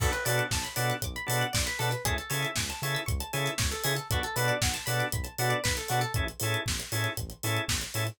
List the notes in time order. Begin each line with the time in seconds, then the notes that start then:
0.00 B1 B3 D4 F#4 A4, kick, crash
0.12 B4, closed hi-hat
0.25 B2 B3 D4 F#4 A4 D5, open hi-hat
0.38 F#5, closed hi-hat
0.51 B1 A5, kick, snare
0.64 B5, closed hi-hat
0.76 B2 B3 D4 F#4 A4 D6, open hi-hat
0.90 F#6, closed hi-hat
1.02 B1 D6, kick, closed hi-hat
1.16 B5, closed hi-hat
1.26 B2 B3 D4 F#4 A4 A5, open hi-hat
1.41 F#5, closed hi-hat
1.53 B1 D5, kick, snare
1.67 B4, closed hi-hat
1.79 B2 B3 D4 F#4 A4, open hi-hat
1.91 B4, closed hi-hat
2.05 C#2 C#4 E4 G#4 A4, kick, closed hi-hat
2.18 A4, closed hi-hat
2.30 C#3 C#4 E4 G#4 A4 C#5, open hi-hat
2.42 E5, closed hi-hat
2.56 C#2 G#5, kick, snare
2.70 A5, closed hi-hat
2.82 C#3 C#4 E4 G#4 A4 C#6, open hi-hat
2.95 E6, closed hi-hat
3.06 C#2 C#6, kick, closed hi-hat
3.20 A5, closed hi-hat
3.33 C#3 C#4 E4 G#4 A4 G#5, open hi-hat
3.46 E5, closed hi-hat
3.58 C#2 C#5, kick, snare
3.71 A4, closed hi-hat
3.84 C#3 C#4 E4 G#4 A4, open hi-hat
3.96 A4, closed hi-hat
4.10 B1 B3 D4 F#4 A4, kick, closed hi-hat
4.23 A4, closed hi-hat
4.36 B2 B3 D4 F#4 A4 B4, open hi-hat
4.48 D5, closed hi-hat
4.62 B1 F#5, kick, snare
4.74 A5, closed hi-hat
4.86 B2 B3 D4 F#4 A4 B5, open hi-hat
5.00 D6, closed hi-hat
5.12 B1 B5, kick, closed hi-hat
5.24 A5, closed hi-hat
5.38 B2 B3 D4 F#4 A4 F#5, open hi-hat
5.50 D5, closed hi-hat
5.64 B1 B4, kick, snare
5.77 A4, closed hi-hat
5.88 B2 B3 D4 F#4 A4, open hi-hat
6.01 A4, closed hi-hat
6.14 A1 C#4 E4 G#4 A4, kick, closed hi-hat
6.28 closed hi-hat
6.40 A2 C#4 E4 G#4 A4, open hi-hat
6.54 closed hi-hat
6.66 A1, kick, snare
6.80 closed hi-hat
6.92 A2 C#4 E4 G#4 A4, open hi-hat
7.04 closed hi-hat
7.17 A1, kick, closed hi-hat
7.30 closed hi-hat
7.43 A2 C#4 E4 G#4 A4, open hi-hat
7.57 closed hi-hat
7.68 A1, kick, snare
7.81 closed hi-hat
7.94 A2 C#4 E4 G#4 A4, open hi-hat
8.07 closed hi-hat